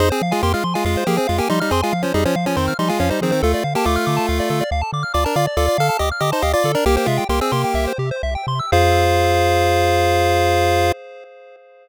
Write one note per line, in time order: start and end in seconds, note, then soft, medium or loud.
0.00 0.12 F2 medium
0.00 0.09 D#4 medium
0.00 0.09 G#4 loud
0.00 0.09 C5 medium
0.10 0.22 C4 medium
0.10 0.22 G#4 medium
0.10 0.20 C5 medium
0.22 0.33 F3 medium
0.22 0.32 F5 medium
0.31 0.42 G#3 medium
0.31 0.42 F4 medium
0.31 0.41 G#5 medium
0.42 0.55 F2 medium
0.42 0.53 A#3 medium
0.42 0.53 G4 medium
0.42 0.53 C6 medium
0.53 0.64 G#3 medium
0.53 0.64 F4 medium
0.53 0.63 F6 medium
0.64 0.76 F3 medium
0.64 0.74 C6 medium
0.74 0.85 G#3 medium
0.74 0.85 F4 medium
0.74 0.84 G#5 medium
0.85 0.97 F2 medium
0.85 1.04 G#3 medium
0.85 1.04 F4 medium
0.85 0.95 F5 medium
0.97 1.07 C5 medium
1.07 1.19 F3 medium
1.07 1.17 A#3 medium
1.07 1.17 G4 medium
1.07 1.16 G#4 medium
1.17 1.27 C4 medium
1.17 1.27 G#4 medium
1.17 1.28 C5 medium
1.27 1.41 F2 medium
1.27 1.39 G#3 medium
1.27 1.39 F4 medium
1.27 1.37 F5 medium
1.38 1.48 A#3 medium
1.38 1.48 G4 medium
1.38 1.49 G#5 medium
1.49 1.62 F3 medium
1.49 1.60 G3 medium
1.49 1.60 D#4 medium
1.49 1.60 C6 medium
1.60 1.72 G3 medium
1.60 1.72 D#4 medium
1.60 1.70 F6 medium
1.71 1.83 F2 medium
1.71 1.81 C4 medium
1.71 1.81 G#4 medium
1.71 1.82 C6 medium
1.82 1.94 G#3 medium
1.82 1.94 F4 medium
1.82 1.92 G#5 medium
1.93 2.05 F3 medium
1.93 2.02 F5 medium
2.02 2.13 F3 medium
2.02 2.13 C#4 medium
2.02 2.13 C5 medium
2.14 2.26 F2 medium
2.14 2.24 G3 medium
2.14 2.24 D#4 medium
2.14 2.24 G#4 loud
2.25 2.36 F3 medium
2.25 2.36 C#4 medium
2.25 2.35 C5 medium
2.36 2.48 F3 medium
2.36 2.45 F5 medium
2.46 2.56 F3 medium
2.46 2.56 C#4 medium
2.46 2.57 G#5 medium
2.57 2.69 F2 medium
2.57 2.74 D#3 medium
2.57 2.74 C4 medium
2.57 2.66 C6 medium
2.68 2.77 F6 medium
2.79 2.91 F3 medium
2.79 2.89 G3 medium
2.79 2.89 D#4 medium
2.79 2.89 C6 medium
2.89 2.99 G#3 medium
2.89 2.99 F4 medium
2.89 2.98 G#5 medium
3.00 3.12 F2 medium
3.00 3.10 F3 medium
3.00 3.10 C#4 medium
3.00 3.10 F5 medium
3.10 3.21 G3 medium
3.10 3.21 D#4 medium
3.10 3.20 C5 medium
3.21 3.31 D#3 medium
3.21 3.33 F3 medium
3.21 3.31 C4 medium
3.21 3.32 G#4 medium
3.31 3.42 D#3 medium
3.31 3.42 C4 medium
3.31 3.41 C5 medium
3.43 3.55 D2 loud
3.43 3.64 A3 medium
3.43 3.64 F4 medium
3.43 3.52 A4 loud
3.54 3.64 D5 medium
3.64 3.76 D3 medium
3.64 3.74 F5 medium
3.75 3.85 A#3 medium
3.75 3.85 G4 medium
3.75 3.86 A5 medium
3.85 3.98 D2 medium
3.85 4.64 A3 medium
3.85 4.64 F4 medium
3.85 3.96 D6 medium
3.96 4.06 F6 medium
4.07 4.19 D3 medium
4.07 4.16 D6 medium
4.17 4.26 A5 medium
4.29 4.41 D2 medium
4.29 4.38 F5 medium
4.40 4.49 D5 medium
4.50 4.62 D3 medium
4.50 4.60 A4 medium
4.61 4.70 D5 medium
4.71 4.83 D2 medium
4.71 4.81 F5 medium
4.82 4.91 A5 medium
4.93 5.04 D3 medium
4.93 5.03 D6 medium
5.03 5.13 F6 medium
5.14 5.26 D2 medium
5.14 5.24 F4 medium
5.14 5.24 D5 medium
5.14 5.23 D6 medium
5.24 5.36 D4 medium
5.24 5.36 A#4 medium
5.24 5.34 A5 medium
5.36 5.48 D3 medium
5.36 5.46 F4 medium
5.36 5.46 D5 medium
5.36 5.46 F5 medium
5.47 5.57 D5 medium
5.57 5.69 D2 loud
5.57 5.77 F4 medium
5.57 5.66 A4 medium
5.57 5.77 D5 medium
5.68 5.78 D5 medium
5.78 5.90 D3 medium
5.78 5.97 A4 medium
5.78 5.88 F5 medium
5.78 5.97 F5 medium
5.89 5.99 A5 medium
5.99 6.12 D2 medium
5.99 6.09 G4 medium
5.99 6.09 D#5 medium
5.99 6.10 D6 medium
6.12 6.21 F6 medium
6.20 6.33 D3 medium
6.20 6.31 G4 medium
6.20 6.31 D#5 medium
6.20 6.31 D6 medium
6.32 6.43 D#4 medium
6.32 6.43 C5 medium
6.32 6.42 A5 medium
6.42 6.55 D2 medium
6.42 6.52 G4 medium
6.42 6.52 D#5 medium
6.42 6.52 F5 medium
6.53 6.72 F4 medium
6.53 6.63 D5 medium
6.53 6.72 D5 medium
6.64 6.76 D3 medium
6.64 6.75 A4 medium
6.75 6.85 D4 medium
6.75 6.85 A#4 medium
6.75 6.84 D5 medium
6.86 6.98 C2 loud
6.86 6.96 A#3 medium
6.86 6.96 G4 loud
6.96 7.07 A#3 medium
6.96 7.07 G4 medium
6.96 7.06 C5 medium
7.06 7.19 C3 medium
7.06 7.24 G#3 medium
7.06 7.24 F4 medium
7.06 7.17 E5 medium
7.18 7.28 G5 medium
7.29 7.41 C2 medium
7.29 7.40 A#3 medium
7.29 7.40 G4 medium
7.29 7.40 C6 medium
7.41 7.52 C4 medium
7.41 7.52 G#4 medium
7.41 7.51 E6 medium
7.52 7.65 C3 medium
7.52 7.93 A#3 medium
7.52 7.93 G4 medium
7.52 7.62 C6 medium
7.64 7.75 G5 medium
7.74 7.87 C2 medium
7.74 7.85 E5 medium
7.87 7.98 C5 medium
7.98 8.12 C3 medium
7.98 8.10 G4 medium
8.11 8.22 C5 medium
8.23 8.37 C2 medium
8.23 8.34 E5 medium
8.35 8.46 G5 medium
8.47 8.61 C3 medium
8.47 8.59 C6 medium
8.59 8.71 E6 medium
8.72 10.92 F2 loud
8.72 10.92 F4 loud
8.72 10.92 G#4 loud
8.72 10.92 C5 loud
8.72 10.92 F5 loud